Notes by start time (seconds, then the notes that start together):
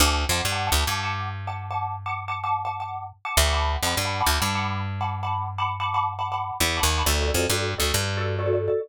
0.00 D2 F#5 A5 D6
0.29 F2 F#5 A5 D6
0.45 G2
0.52 F#5 A5 D6
0.67 F#5 A5 D6
0.72 D2
0.87 G2 F#5 A5 D6
1.03 F#5 A5 D6
1.47 F#5 A5 D6
1.71 F#5 A5 D6
2.06 F#5 A5 D6
2.28 F#5 A5 D6
2.44 F#5 A5 D6
2.65 F#5 A5 D6
2.80 F#5 A5 D6
3.25 F#5 A5 D6
3.37 D2
3.46 F#5 A5 D6
3.53 F#5 A5 B5 D6
3.83 F2 F#5 A5 B5 D6
3.97 G2
4.05 F#5 A5 B5 D6
4.20 F#5 A5 B5 D6
4.26 D2
4.40 G2 F#5 A5 B5 D6
4.55 F#5 A5 B5 D6
5.01 F#5 A5 B5 D6
5.23 F#5 A5 B5 D6
5.58 F#5 A5 B5 D6
5.80 F#5 A5 B5 D6
5.94 F#5 A5 B5 D6
6.19 F#5 A5 B5 D6
6.32 F#5 A5 B5 D6
6.60 E2
6.77 F#5 A5 B5 D6
6.83 D#2
6.98 F#5 A5 B5 D6
7.06 D2 F#4 A4 D5
7.21 F#4 A4 D5
7.28 F#4 A4 D5
7.34 F2 F#4 A4 D5
7.50 G2 F#4 A4 D5
7.78 D2 F#4 A4 D5
7.94 G2
8.17 F#4 A4 D5
8.39 F#4 A4 D5
8.46 F#4 A4 D5
8.53 F#4 A4 D5
8.68 F#4 A4 D5